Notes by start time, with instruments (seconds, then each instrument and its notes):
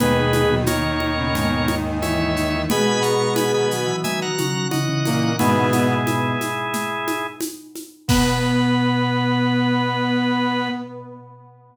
0.00 brass section D#2 D#3, drawbar organ B2 G#4 B4, flute B3 B4, low conga, shaker
0.17 flute G#3 G#4
0.33 flute G#3 G#4, high conga, shaker
0.51 drawbar organ B2, flute F#3 F#4
0.66 flute D#3 D#4, drawbar organ A#4 C#5, high conga, shaker
0.84 flute D#3 D#4
1.00 high conga
1.18 drawbar organ B2, flute C#3 C#4
1.34 drawbar organ G#2, flute B2 B3, low conga, shaker
1.68 flute D#3 D#4, high conga, shaker
2.02 flute E3 E4, drawbar organ C#5 E5, high conga, shaker
2.37 flute D#3 D#4, shaker
2.53 flute E3 E4
2.69 brass section B2 B3, drawbar organ B2 G#5 B5, flute G#3 G#4, low conga, shaker
3.01 drawbar organ B2 A#5 C#6, shaker
3.36 drawbar organ G#5 B5, high conga, shaker
3.54 drawbar organ D#3 G#5 B5
3.71 flute F#3 F#4, shaker
3.86 drawbar organ E3
4.04 drawbar organ D#3 E5 G#5, low conga, shaker
4.22 drawbar organ F#5 A#5
4.38 drawbar organ C#3, high conga, shaker
4.71 drawbar organ C#3 D#5 F#5, flute E3 E4, high conga, shaker
4.89 drawbar organ C#3
5.05 brass section A#2 A#3, high conga, shaker
5.39 drawbar organ G#2 B2 E4 G#4, brass section B2 B3, flute D#3 D#4, low conga, shaker
5.72 flute B2 B3, high conga, shaker
6.07 high conga, shaker
6.41 high conga, shaker
6.73 low conga, shaker
7.07 high conga, shaker
7.41 high conga, shaker
7.75 high conga, shaker
8.08 drawbar organ B2 B4, brass section B3, flute B3, kick, crash